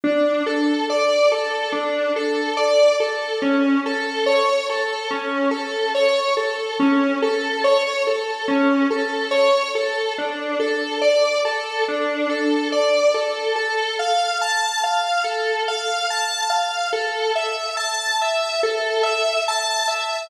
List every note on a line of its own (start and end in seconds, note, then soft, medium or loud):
0.04 0.43 D4 medium
0.46 0.85 A4 medium
0.90 1.29 D5 medium
1.32 1.71 A4 medium
1.72 2.11 D4 medium
2.16 2.55 A4 medium
2.57 2.96 D5 medium
3.00 3.39 A4 medium
3.42 3.81 C#4 medium
3.86 4.25 A4 medium
4.26 4.65 C#5 medium
4.70 5.08 A4 medium
5.11 5.49 C#4 medium
5.51 5.90 A4 medium
5.95 6.33 C#5 medium
6.37 6.76 A4 medium
6.80 7.18 C#4 medium
7.22 7.61 A4 medium
7.64 8.03 C#5 medium
8.07 8.46 A4 medium
8.48 8.87 C#4 medium
8.90 9.29 A4 medium
9.31 9.70 C#5 medium
9.75 10.14 A4 medium
10.18 10.57 D4 medium
10.60 10.98 A4 medium
11.01 11.40 D5 medium
11.45 11.84 A4 medium
11.88 12.27 D4 medium
12.29 12.68 A4 medium
12.72 13.11 D5 medium
13.14 13.53 A4 medium
13.56 13.95 A4 medium
13.99 14.38 F5 medium
14.41 14.80 A5 medium
14.84 15.22 F5 medium
15.24 15.63 A4 medium
15.68 16.07 F5 medium
16.10 16.49 A5 medium
16.50 16.89 F5 medium
16.93 17.32 A4 medium
17.35 17.74 E5 medium
17.77 18.16 A5 medium
18.21 18.60 E5 medium
18.63 19.02 A4 medium
19.03 19.42 E5 medium
19.48 19.87 A5 medium
19.88 20.27 E5 medium